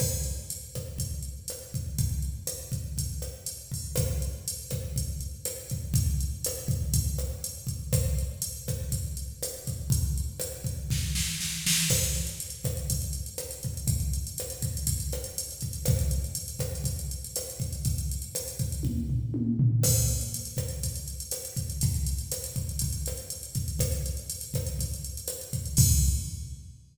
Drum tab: CC |x---------------|----------------|----------------|----------------|
HH |--x-x-x-x-x-x-x-|x-x-x-x-x-x-x-o-|x-x-x-x-x-x-x-x-|x-x-x-x-x-x-x-x-|
SD |r-----r-----r---|----r-----r-----|r-----r-----r---|----r-----r-----|
T1 |----------------|----------------|----------------|----------------|
FT |----------------|----------------|----------------|----------------|
BD |o-----o-o-----o-|o-----o-o-----o-|o-----o-o-----o-|o-----o-o-----o-|

CC |----------------|----------------|x---------------|----------------|
HH |x-x-x-x-x-x-x-x-|x-x-x-x---------|-xxxxxxxxxxxxxxx|xxxxxxxxxxxxxxxx|
SD |r-----r-----r---|----r---o-o-o-o-|r-----r-----r---|----r-----r-----|
T1 |----------------|----------------|----------------|----------------|
FT |----------------|----------------|----------------|----------------|
BD |o-----o-o-----o-|o-----o-o-------|o-----o-o-----o-|o-----o-o-----o-|

CC |----------------|----------------|x---------------|----------------|
HH |xxxxxxxxxxxxxxxx|xxxxxxxx--------|-xxxxxxxxxxxxxxx|xxxxxxxxxxxxxxxx|
SD |r-----r-----r---|----r-----------|r-----r-----r---|----r-----r-----|
T1 |----------------|--------o---o---|----------------|----------------|
FT |----------------|----------o---o-|----------------|----------------|
BD |o-----o-o-----o-|o-----o-o-------|o-----o-o-----o-|o-----o-o-----o-|

CC |----------------|x---------------|
HH |xxxxxxxxxxxxxxxx|----------------|
SD |r-----r-----r---|----------------|
T1 |----------------|----------------|
FT |----------------|----------------|
BD |o-----o-o-----o-|o---------------|